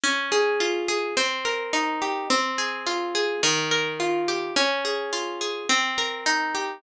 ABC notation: X:1
M:4/4
L:1/8
Q:1/4=106
K:Fm
V:1 name="Acoustic Guitar (steel)"
D A F A C B E G | C A F A E, B F G | D A F A C B E G |]